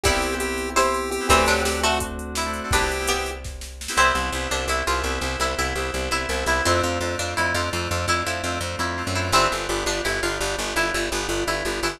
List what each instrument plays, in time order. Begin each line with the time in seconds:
0.03 electric bass (finger) C2, pizzicato strings G3 E4, electric piano 2 B3 C4 E4 G4, pad 5 (bowed) B3 C4 E4 G4, lead 1 (square) G4, kick, closed hi-hat
0.14 electric piano 2 B3 C4 E4 G4
0.22 closed hi-hat
0.32 electric piano 2 B3 C4 E4 G4
0.40 lead 1 (square) G4, closed hi-hat
0.58 closed hi-hat
0.76 pizzicato strings E4 C5, lead 1 (square) G4, snare
0.94 closed hi-hat
1.11 lead 1 (square) G4, closed hi-hat
1.20 electric piano 2 B3 C4 E4 G4
1.29 electric bass (finger) D2, pizzicato strings E3 C4, pad 5 (bowed) A3 C4 D4 F#4, electric piano 2 A3 C4 D4 F#4, lead 1 (square) G4, kick, closed hi-hat
1.39 electric piano 2 A3 C4 D4 F#4
1.46 pizzicato strings F#3 D4, closed hi-hat
1.57 electric piano 2 A3 C4 D4 F#4
1.65 lead 1 (square) G4, snare
1.83 pizzicato strings A3 F#4, lead 1 (square) F#4, closed hi-hat
2.00 kick, closed hi-hat
2.19 closed hi-hat
2.35 pizzicato strings E4, snare
2.46 electric piano 2 A3 C4 D4 F#4
2.54 closed hi-hat
2.64 electric piano 2 A3 C4 D4 F#4
2.71 electric bass (finger) C2, electric piano 2 B3 C4 E4 G4, pizzicato strings D4 B4, lead 1 (square) G4, kick, closed hi-hat
2.81 electric piano 2 B3 C4 E4 G4
2.92 closed hi-hat
2.99 electric piano 2 B3 C4 E4 G4
3.07 pizzicato strings B3 G4, closed hi-hat
3.26 closed hi-hat
3.44 kick, snare
3.61 snare
3.81 snare
3.88 electric piano 2 B3 C4 E4 G4, snare
3.97 electric bass (finger) C2, electric piano 2 B3 C4 E4 G4, pizzicato strings C4 E4
4.15 electric bass (finger) C2
4.32 electric bass (finger) C2, electric piano 2 B3 C4 E4 G4
4.51 electric bass (finger) C2, pizzicato strings D4
4.68 electric bass (finger) C2, pizzicato strings E4
4.87 electric bass (finger) C2, electric piano 2 B3 C4 E4 G4, pizzicato strings F4
5.04 electric bass (finger) C2, electric piano 2 B3 C4 E4 G4
5.21 electric bass (finger) C2, electric piano 2 B3 C4 E4 G4
5.40 electric bass (finger) C2, pizzicato strings E4
5.58 electric bass (finger) C2, pizzicato strings E4
5.75 electric bass (finger) C2, electric piano 2 B3 C4 E4 G4
5.94 electric bass (finger) C2
6.11 electric bass (finger) C2, pizzicato strings E4
6.29 electric bass (finger) C2, electric piano 2 B3 C4 E4 G4
6.46 electric bass (finger) C2, electric piano 2 B3 C4 E4 G4, pizzicato strings E4
6.65 electric bass (finger) F2, electric piano 2 A3 C4 D4 F4, pizzicato strings C4 E4
6.83 electric bass (finger) F2
7.01 electric bass (finger) F2, electric piano 2 A3 C4 D4 F4
7.19 electric bass (finger) F2, pizzicato strings D4
7.37 electric bass (finger) F2, pizzicato strings E4
7.54 electric bass (finger) F2, electric piano 2 A3 C4 D4 F4, pizzicato strings F4
7.72 electric bass (finger) F2, electric piano 2 A3 C4 D4 F4
7.90 electric bass (finger) F2, electric piano 2 A3 C4 D4 F4
8.08 electric bass (finger) F2, pizzicato strings E4
8.26 electric bass (finger) F2, pizzicato strings E4
8.44 electric bass (finger) F2, electric piano 2 A3 C4 D4 F4
8.61 electric bass (finger) F2
8.79 electric bass (finger) F2, pizzicato strings E4
8.97 electric piano 2 A3 C4 D4 F4
9.07 electric bass (finger) F#2
9.15 electric piano 2 A3 C4 D4 F4, pizzicato strings E4
9.32 electric bass (finger) G1, electric piano 2 G3 B3 D4 F4, pizzicato strings C4 E4
9.52 electric bass (finger) G1
9.69 electric bass (finger) G1, electric piano 2 G3 B3 D4 F4
9.86 electric bass (finger) G1, pizzicato strings D4
10.05 electric bass (finger) G1, pizzicato strings E4
10.22 electric bass (finger) G1, electric piano 2 G3 B3 D4 F4, pizzicato strings F4
10.40 electric bass (finger) G1, electric piano 2 G3 B3 D4 F4
10.58 electric bass (finger) G1, electric piano 2 G3 B3 D4 F4
10.76 electric bass (finger) G1, pizzicato strings E4
10.94 electric bass (finger) G1, pizzicato strings E4
11.12 electric bass (finger) G1, electric piano 2 G3 B3 D4 F4
11.29 electric bass (finger) G1
11.47 electric bass (finger) G1, pizzicato strings E4
11.65 electric bass (finger) G1, electric piano 2 G3 B3 D4 F4
11.83 electric bass (finger) G1, electric piano 2 G3 B3 D4 F4, pizzicato strings E4